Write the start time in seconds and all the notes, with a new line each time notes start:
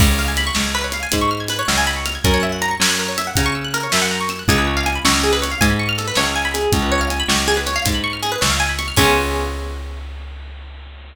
0.00 C#2 B4, kick, crash
0.09 C#5
0.19 F5
0.28 G#5
0.37 B5, closed hi-hat
0.47 C#6
0.55 C#2 F6, snare
0.65 G#6
0.75 B4
0.84 C#5
0.92 F5, closed hi-hat
1.03 G#5
1.12 G#2 B5, kick, closed hi-hat
1.21 C#6
1.31 F6
1.40 G#6
1.48 B4, closed hi-hat
1.59 C#5
1.68 C#2 F5, snare
1.78 G#5
1.87 B5
1.96 C#6
2.06 F6, closed hi-hat
2.15 G#6
2.24 F#2 A#4, kick, closed hi-hat
2.34 C#5
2.43 E5
2.52 F#5
2.62 A#5, closed hi-hat
2.71 C#6
2.80 F#2 E6, snare
2.90 F#6
2.99 A#4
3.08 C#5
3.18 E5, closed hi-hat
3.27 F#5
3.36 C#3 A#5, kick, closed hi-hat
3.46 C#6
3.55 E6
3.64 F#6
3.74 A#4, closed hi-hat
3.83 C#5
3.92 F#2 E5, snare
4.02 F#5
4.11 A#5
4.21 C#6
4.29 E6, closed hi-hat
4.39 F#6
4.48 C#2 G#4, kick, closed hi-hat
4.58 B4
4.67 C#5
4.77 F5
4.86 G#5, closed hi-hat
4.95 B5
5.04 C#2 C#6, snare
5.14 F6
5.23 G#4
5.33 B4
5.42 C#5, closed hi-hat
5.51 F5
5.61 G#2 G#5, kick, closed hi-hat
5.70 B5
5.79 C#6
5.89 F6
5.98 A4, closed hi-hat
6.07 B4
6.15 C#2 C#5, snare
6.26 F5
6.36 G#5
6.45 B5
6.54 G#4, closed hi-hat
6.72 C#2, kick, closed hi-hat
6.82 B4
6.92 C#5
7.01 F5
7.10 G#5, closed hi-hat
7.20 B5
7.28 C#2 C#6, snare
7.38 F6
7.48 G#4
7.57 B4
7.66 C#5, closed hi-hat
7.76 F5
7.85 G#2 G#5, kick, closed hi-hat
7.94 B5
8.04 C#6
8.13 F6
8.23 G#4, closed hi-hat
8.32 B4
8.41 C#2 C#5, snare
8.50 F5
8.60 G#5
8.69 B5
8.79 C#6, closed hi-hat
8.88 F6
8.96 C#2 B3 C#4 F4 G#4, kick, crash